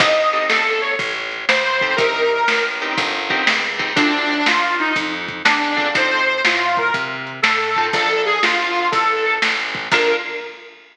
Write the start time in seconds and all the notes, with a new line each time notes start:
0.00 A1 C4 D#4 G4 A4 D#5, kick, crash
0.33 C4 D#4 G4 A4, closed hi-hat
0.49 G1 A4, snare
0.82 C#5, closed hi-hat
0.99 A1, kick, closed hi-hat
1.32 closed hi-hat
1.49 C#2 C5, snare
1.81 C4 D#4 G4 A4, kick, closed hi-hat
1.96 C2 C4 D#4 G4 A#4, kick, closed hi-hat
2.31 closed hi-hat
2.48 A1, snare
2.80 C4 D#4 G4 A#4, closed hi-hat
2.98 G1, kick, closed hi-hat
3.30 C4 D#4 G4 A#4, kick, closed hi-hat
3.47 C#2, snare
3.79 C4 D#4 G4 A#4, kick, closed hi-hat
3.96 D2 C4 D4 F4 A4, kick, closed hi-hat
4.29 closed hi-hat
4.46 D#2 F4, snare
4.79 D#4, closed hi-hat
4.96 F2, kick, closed hi-hat
5.28 kick, closed hi-hat
5.45 E2 D4, snare
5.77 C4 D4 F4 A4, kick, closed hi-hat
5.95 F2 C4 D#4 F4 A4 C5, kick, closed hi-hat
6.28 closed hi-hat
6.45 A2 F4, snare
6.77 A#4, kick, closed hi-hat
6.94 C3, kick, closed hi-hat
7.27 closed hi-hat
7.42 A2 A4, snare
7.76 C4 D#4 F4 A4, kick, closed hi-hat
7.93 A#1 D4 F4 A4 A#4, kick, closed hi-hat
8.26 G#4, closed hi-hat
8.42 G1 F4, snare
8.76 closed hi-hat
8.92 A1 A4, kick, closed hi-hat
9.25 closed hi-hat
9.42 A1, snare
9.75 kick, closed hi-hat
9.92 A#1 A#3 D4 F4 A4 A#4, kick, crash